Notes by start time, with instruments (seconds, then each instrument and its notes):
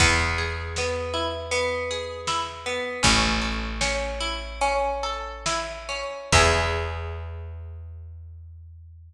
0.00 electric bass (finger) E2, orchestral harp B3, kick, crash
0.38 orchestral harp G#4
0.76 orchestral harp B3, snare
1.14 orchestral harp E4
1.51 orchestral harp B3, closed hi-hat
1.91 orchestral harp G#4
2.27 orchestral harp E4, snare
2.66 orchestral harp B3
3.03 electric bass (finger) A1, orchestral harp C#4, kick, closed hi-hat
3.42 orchestral harp A4
3.81 orchestral harp C#4, snare
4.21 orchestral harp E4
4.61 orchestral harp C#4, closed hi-hat
5.03 orchestral harp A4
5.46 orchestral harp E4, snare
5.89 orchestral harp C#4
6.32 electric bass (finger) E2, orchestral harp B3 E4 G#4, kick, crash